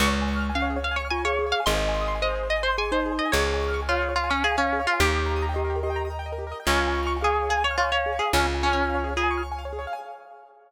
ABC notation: X:1
M:12/8
L:1/16
Q:3/8=144
K:Dblyd
V:1 name="Pizzicato Strings"
d'6 z2 f4 f2 d2 a2 d4 f2 | c'6 z2 e4 e2 c2 a2 c4 e2 | d6 z2 F4 F2 D2 A2 D4 F2 | G18 z6 |
D6 z2 A4 A2 d2 F2 d4 A2 | D2 z2 D2 D6 A4 z8 |]
V:2 name="Glockenspiel"
A,8 D4 z4 F2 A6 | e8 c4 z4 A2 E6 | A8 d4 z4 f2 f6 | G8 G4 G4 z8 |
F8 A4 z4 d2 f6 | F12 F4 z8 |]
V:3 name="Acoustic Grand Piano"
A d f a d' f' d' a f d A d f a d' f' d' a f d A d f a | A c e a c' e' c' a e c A c e a c' e' c' a e c A c e a | A d f a d' f' d' a f d A d f a d' f' d' a f d A d f a | G B e g b e' b g e B G B e g b e' b g e B G B e g |
A d f a d' f' d' a f d A d f a d' f' d' a f d A d f a | A d f a d' f' d' a f d A d f a d' f' d' a f d A d f a |]
V:4 name="Electric Bass (finger)" clef=bass
D,,24 | A,,,24 | D,,24 | E,,24 |
D,,24 | D,,24 |]